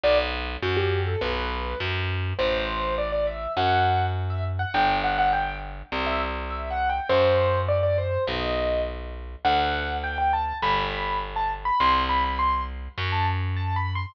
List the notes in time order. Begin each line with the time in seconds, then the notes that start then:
0.04 B1 D5
0.62 F#2 F#4
0.77 G4
1.06 A4
1.21 B1 B4
1.80 F#2
2.39 A1 C5
2.98 D5
3.12 D5
3.27 E5
3.57 F#2 F#5
4.30 E5
4.59 F#5
4.74 G1 G5
5.04 F#5
5.18 F#5
5.33 G5
5.92 C2
6.07 E5
6.50 E5
6.70 F#5
6.90 G5
7.09 F#2 C5
7.69 D5
7.83 D5
7.98 C5
8.27 B1 D#5
9.45 D2 F#5
10.04 G5
10.18 G5
10.33 A5
10.62 G1 B5
11.36 A5
11.65 B5
11.80 C2 C6
12.09 B5
12.24 B5
12.39 C6
12.98 F#2
13.12 A5
13.56 A5
13.76 B5
13.95 C6